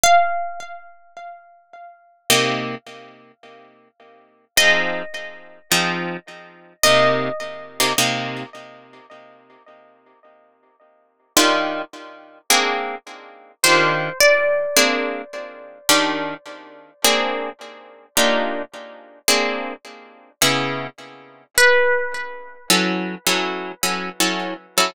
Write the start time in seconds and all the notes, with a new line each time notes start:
0.04 F5
2.30 C3 A#3 D#4 G4
4.57 F3 C4 D#4 G#4 D#5
5.72 F3 C4 D#4 G#4
6.83 C3 A#3 D#4 G4 D#5
7.80 C3 A#3 D#4 G4
7.98 C3 A#3 D#4 G4
11.37 D#3 D4 F4 G4
12.50 A#3 C4 D4 G#4
13.64 D#3 D4 F4 G4 C5
14.20 D5
14.77 A#3 C4 D4 G#4
15.89 D#3 D4 F4 G4
17.04 A#3 C4 D4 G#4
18.17 A#3 D4 D#4 F4 G4
19.28 A#3 C4 D4 G#4
20.42 C#3 B3 E4 G#4
21.58 B4
22.70 F#3 C#4 E4 A4
23.27 F#3 C#4 E4 A4
23.83 F#3 C#4 E4 A4
24.20 F#3 C#4 E4 A4
24.78 F#3 C#4 E4 A4